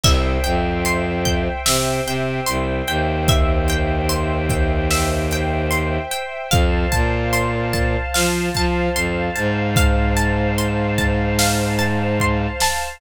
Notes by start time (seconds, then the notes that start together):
0.03 C2 C5 E5 G5, kick, crash
0.44 F2 G5, closed hi-hat
0.85 C6, closed hi-hat
1.25 G5, kick, closed hi-hat
1.66 C3 E5, snare
2.06 C3 G5, closed hi-hat
2.46 C2 C6, closed hi-hat
2.88 D#2 G5, closed hi-hat
3.28 E5, kick, closed hi-hat
3.68 G5, closed hi-hat
4.09 C6, closed hi-hat
4.49 G5, kick, closed hi-hat
4.91 E5, snare
5.31 G5, closed hi-hat
5.71 C6, closed hi-hat
6.11 G5, closed hi-hat
6.51 F2 C5 F5 A5, kick, closed hi-hat
6.92 A#2 A5, kick, closed hi-hat
7.33 C6, closed hi-hat
7.73 A5, kick, closed hi-hat
8.14 F3 F5, snare
8.54 F3 A5, kick, closed hi-hat
8.95 F2 C6, closed hi-hat
9.35 G#2 A5, closed hi-hat
9.76 F5, kick, closed hi-hat
10.17 A5, closed hi-hat
10.58 C6, closed hi-hat
10.98 A5, kick, closed hi-hat
11.39 F5, snare
11.79 A5, closed hi-hat
12.20 C6, kick
12.60 A5, snare